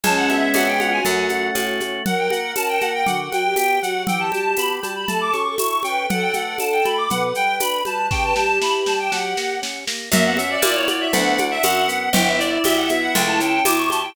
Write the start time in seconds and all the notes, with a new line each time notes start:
0.03 C#2 G#3 C#4 A5, low conga, shaker
0.17 F#5
0.29 B3 E5, high conga, shaker
0.54 F2 C#4 F#5, tambourine, high conga, shaker
0.67 G5
0.79 F4 F#5, high conga, shaker
0.92 F#4 G#5
1.05 F#2 A3 F#5, low conga, shaker
1.29 C#4, high conga, shaker
1.55 A2 F#4, tambourine, high conga, shaker
1.80 A3, high conga, shaker
2.05 F#3 A#4 F#5, low conga, shaker
2.18 G5
2.30 A#3 F#5, high conga, shaker
2.56 C#4 A5, tambourine, high conga, shaker
2.69 G5
2.81 A#3 F#5, high conga, shaker
2.95 G5
3.06 D3 F#4 F#5, low conga, shaker
3.32 F#3 G5, high conga, shaker
3.44 G4
3.56 B3 G5, tambourine, high conga, shaker
3.82 F#3 F#4 F#5, shaker
4.07 E3 G4 G5, low conga, shaker
4.20 A5
4.32 G3 A5, high conga, shaker
4.57 B3 B5, tambourine, high conga, shaker
4.83 G3 A5, high conga, shaker
4.95 B5
5.08 A3 A4 A5, low conga, shaker
5.21 D6
5.33 C#4 C#6, high conga, shaker
5.47 A4
5.58 E4 C#6, tambourine, high conga, shaker
5.83 C#4 B4 G5, high conga, shaker
6.09 F#3 A4 F#5, low conga, shaker
6.22 G5
6.33 A3 F#5, high conga, shaker
6.58 D4 A5, tambourine, high conga, shaker
6.72 G5
6.85 A3 B5, high conga, shaker
6.98 D6
7.10 B2 B4 F#5, low conga, shaker
7.35 G3 G5, shaker
7.60 D4 B5, tambourine, high conga, shaker
7.85 G3 B4 A5, high conga, shaker
8.11 C#3 G4 G5, kick, snare
8.24 B4 A5
8.34 G3 G4 A5, snare
8.49 G4
8.61 E4 B5, snare
8.86 G3 A5, snare
8.99 G5
9.12 F#3 F#5, snare
9.37 A#3, snare
9.62 C#4, snare
9.87 A#3, snare
10.12 F#2 A#3 E5, low conga, shaker
10.26 B3 F#5
10.37 C#4 E5, high conga, shaker
10.50 D5
10.62 A#2 E4 D5, tambourine, high conga, shaker
10.75 C#5
10.88 F#4 D5, high conga, shaker
11.01 E5
11.13 D2 B3 D4 F#5, low conga, shaker
11.38 D4, high conga, shaker
11.51 E5
11.63 F#2 F#4 F#5, tambourine, high conga, shaker
11.88 B3, shaker
12.13 G1 B3 E4 G5, low conga, shaker
12.27 E5
12.39 E4 D5, shaker
12.64 B1 G4 E5, tambourine, high conga, shaker
12.77 F#5
12.89 B3 E5, high conga, shaker
13.02 F#5
13.15 C#2 A3 G5, low conga, shaker
13.27 A5
13.40 C#4 G5, shaker
13.65 E2 E4 D6, tambourine, high conga, shaker
13.78 C#6
13.90 G4 A5, high conga, shaker
14.03 G5